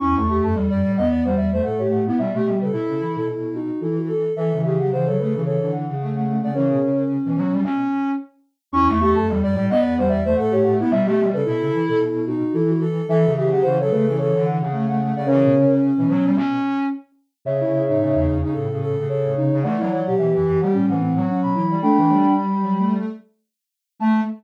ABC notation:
X:1
M:4/4
L:1/16
Q:"Swing 16ths" 1/4=110
K:Amix
V:1 name="Ocarina"
c' c'2 a z3 f3 e2 f c f2 | e e2 B z3 A3 F2 A F A2 | e2 e f f c B2 c2 f3 f2 f | [^Ac]4 z12 |
c' c'2 a z3 f3 e2 f c f2 | e e2 B z3 A3 F2 A F A2 | e2 e f f c B2 c2 f3 f2 f | [^Ac]4 z12 |
[ce]6 z6 c4 | [df]4 e z2 f z f4 b3 | [gb]4 b4 z8 | a4 z12 |]
V:2 name="Ocarina"
E2 G A2 d2 _e d =c d c A G2 =E | z G2 A4 A E2 ^D2 E2 A2 | A2 G G =c A3 A2 z5 d | C10 z6 |
E2 G A2 d2 _e d =c d c A G2 =E | z G2 A4 A E2 ^D2 E2 A2 | A2 G G =c A3 A2 z5 d | C10 z6 |
z E2 ^D4 D A2 A2 A2 D2 | z E2 G4 G C2 ^B,2 C2 E2 | D4 z12 | A,4 z12 |]
V:3 name="Ocarina"
C A, A,2 G, G, G, B,2 G,2 A,4 B, | G, A, G,2 E4 z8 | E, C, C,2 C, C, C, C,2 D,2 C,4 C, | C,2 z3 E, F, G, C4 z4 |
C A, A,2 G, G, G, B,2 G,2 A,4 B, | G, A, G,2 E4 z8 | E, C, C,2 C, C, C, C,2 D,2 C,4 C, | C,2 z3 E, F, G, C4 z4 |
C, C, C,2 C, C, C, C,2 C,2 C,4 C, | A, F, F,2 E, E, E, G,2 E,2 F,4 G, | D, E, G,8 z6 | A,4 z12 |]
V:4 name="Ocarina"
E,, E,,2 F,, E,, F,, A,, E,,5 A,,4 | B,, B,,2 C, B,, C, E, B,,5 E,4 | E, E,2 F, E, F, A, E,5 A,4 | E, B,, C,3 B,,5 z6 |
E,, E,,2 F,, E,, F,, A,, E,,5 A,,4 | B,, B,,2 C, B,, C, E, B,,5 E,4 | E, E,2 F, E, F, A, E,5 A,4 | E, B,, C,3 B,,5 z6 |
C,3 A,,2 E,, E,, z A,,4 z A,, C,2 | E,3 B,,2 F,, F,, z A,,4 z B,, E,2 | A, A,2 z3 F, A,3 z6 | A,4 z12 |]